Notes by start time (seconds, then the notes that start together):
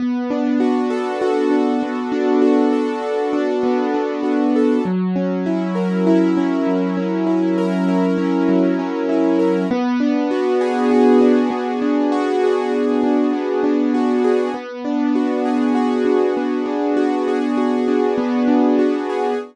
0.00 B3
0.30 D4
0.60 F#4
0.90 A4
1.21 F#4
1.51 D4
1.83 B3
2.12 D4
2.42 F#4
2.72 A4
3.02 F#4
3.33 D4
3.63 B3
3.94 D4
4.23 F#4
4.56 A4
4.85 F#3
5.16 C#4
5.46 E4
5.75 A#4
6.07 E4
6.37 C#4
6.67 F#3
6.97 C#4
7.27 E4
7.58 A#4
7.88 E4
8.18 C#4
8.49 F#3
8.79 C#4
9.09 E4
9.39 A#4
9.71 B3
10.00 D4
10.31 F#4
10.61 G#4
10.91 F#4
11.21 D4
11.50 B3
11.82 D4
12.12 F#4
12.44 G#4
12.72 F#4
13.03 D4
13.33 B3
13.64 D4
13.94 F#4
14.24 G#4
14.54 B3
14.85 D4
15.15 F#4
15.45 G#4
15.75 F#4
16.05 D4
16.37 B3
16.66 D4
16.97 F#4
17.28 G#4
17.57 F#4
17.88 D4
18.18 B3
18.48 D4
18.79 F#4
19.09 G#4